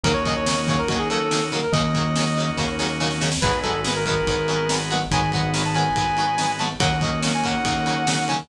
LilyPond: <<
  \new Staff \with { instrumentName = "Brass Section" } { \time 4/4 \key ees \dorian \tempo 4 = 142 bes'16 des''16 ees''16 des''8. des''16 bes'16 ges'16 aes'16 a'4 r16 bes'16 | ees''2 r2 | ces''8 a'8 r16 bes'16 bes'2 ges''16 r16 | aes''8 ges''8 r16 a''16 aes''2 a''16 r16 |
ges''8 ees''8 r16 aes''16 ges''2 aes''16 r16 | }
  \new Staff \with { instrumentName = "Acoustic Guitar (steel)" } { \time 4/4 \key ees \dorian <des ees ges bes>8 <des ees ges bes>8 <des ees ges bes>8 <des ees ges bes>8 <des ees ges bes>8 <des ees ges bes>8 <des ees ges bes>8 <des ees ges bes>8 | <des ees ges bes>8 <des ees ges bes>8 <des ees ges bes>8 <des ees ges bes>8 <des ees ges bes>8 <des ees ges bes>8 <des ees ges bes>8 <des ees ges bes>8 | <ees ges aes ces'>8 <ees ges aes ces'>8 <ees ges aes ces'>8 <ees ges aes ces'>8 <ees ges aes ces'>8 <ees ges aes ces'>8 <ees ges aes ces'>8 <ees ges aes ces'>8 | <ees ges aes ces'>8 <ees ges aes ces'>8 <ees ges aes ces'>8 <ees ges aes ces'>8 <ees ges aes ces'>8 <ees ges aes ces'>8 <ees ges aes ces'>8 <ees ges aes ces'>8 |
<des ees ges bes>8 <des ees ges bes>8 <des ees ges bes>8 <des ees ges bes>8 <des ees ges bes>8 <des ees ges bes>8 <des ees ges bes>8 <des ees ges bes>8 | }
  \new Staff \with { instrumentName = "Drawbar Organ" } { \time 4/4 \key ees \dorian <bes des' ees' ges'>1 | <bes des' ees' ges'>1 | <aes ces' ees' ges'>1 | <aes ces' ees' ges'>1 |
<bes des' ees' ges'>1 | }
  \new Staff \with { instrumentName = "Synth Bass 1" } { \clef bass \time 4/4 \key ees \dorian ees,2 ees,2 | ees,2 ees,2 | aes,,2 aes,,2 | aes,,2 aes,,2 |
ees,2 ees,2 | }
  \new DrumStaff \with { instrumentName = "Drums" } \drummode { \time 4/4 <bd cymr>8 <bd cymr>8 sn8 <bd cymr>8 <bd cymr>8 cymr8 sn8 cymr8 | <bd cymr>8 <bd cymr>8 sn8 cymr8 <bd sn>8 sn8 sn16 sn16 sn16 sn16 | <cymc bd>8 <bd cymr>8 sn8 <bd cymr>8 <bd cymr>8 cymr8 sn8 cymr8 | <bd cymr>8 <bd cymr>8 sn8 cymr8 <bd cymr>8 cymr8 sn8 cymr8 |
<bd cymr>8 <bd cymr>8 sn8 <bd cymr>8 <bd cymr>8 cymr8 sn8 cymr8 | }
>>